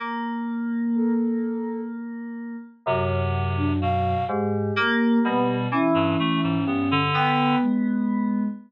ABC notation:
X:1
M:9/8
L:1/16
Q:3/8=42
K:none
V:1 name="Electric Piano 2"
^A,12 ^F,,6 | ^G,,2 ^A,2 B,,2 E,4 =G,,2 B,6 |]
V:2 name="Clarinet"
z12 C,4 B,,2 | z4 G,2 z G,, A, ^G,, B, D,3 z4 |]
V:3 name="Ocarina"
z4 A4 z7 D f2 | G6 ^C6 g2 ^G,4 |]